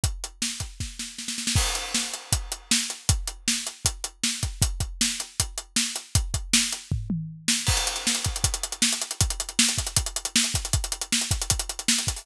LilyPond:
\new DrumStaff \drummode { \time 4/4 \tempo 4 = 157 <hh bd>8 hh8 sn8 <hh bd>8 <bd sn>8 sn8 sn16 sn16 sn16 sn16 | <cymc bd>8 hh8 sn8 hh8 <hh bd>8 hh8 sn8 hh8 | <hh bd>8 hh8 sn8 hh8 <hh bd>8 hh8 sn8 <hh bd>8 | <hh bd>8 <hh bd>8 sn8 hh8 <hh bd>8 hh8 sn8 hh8 |
<hh bd>8 <hh bd>8 sn8 hh8 <bd tomfh>8 toml8 r8 sn8 | <cymc bd>16 hh16 hh16 hh16 sn16 hh16 <hh bd>16 hh16 <hh bd>16 hh16 hh16 hh16 sn16 hh16 hh16 hh16 | <hh bd>16 hh16 hh16 hh16 sn16 hh16 <hh bd>16 hh16 <hh bd>16 hh16 hh16 hh16 sn16 hh16 <hh bd>16 hh16 | <hh bd>16 hh16 hh16 hh16 sn16 hh16 <hh bd>16 hh16 <hh bd>16 hh16 hh16 hh16 sn16 hh16 <hh bd>16 hho16 | }